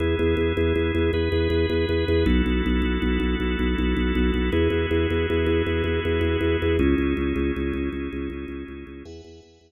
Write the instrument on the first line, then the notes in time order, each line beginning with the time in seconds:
drawbar organ
0.00 E2 B3 E4 G#4
0.19 E2
0.37 E2
0.57 E2
0.76 E2
0.95 E2
1.13 E2 B3 G#4 B4
1.32 E2
1.50 E2
1.70 E2
1.89 E2
2.08 E2
2.26 B1 B3 E4 F#4 A4
2.46 B1
2.66 B1
2.82 B1
3.02 B1
3.20 B1
3.40 B1
3.59 B1
3.78 B1
3.97 B1
4.15 B1
4.34 B1
4.52 E2 B3 E4 F#4 G#4
4.70 E2
4.91 E2
5.10 E2
5.30 E2
5.46 E2
5.67 E2
5.84 E2
6.05 E2
6.21 E2
6.41 E2
6.62 E2
6.79 C#2 C#4 D#4 E4 G#4
6.98 C#2
7.17 C#2
7.36 C#2
7.56 C#2
7.73 C#2
7.93 C#2
8.13 C#2
8.30 C#2
8.48 C#2
8.68 C#2
8.87 C#2
9.05 E2 B4 E5 F#5 G#5
9.24 E2
9.43 E2
9.61 E2